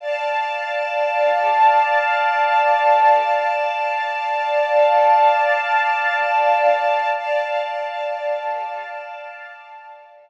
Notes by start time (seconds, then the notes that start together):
0.00 D5 F5 A5
7.16 D5 F5 A5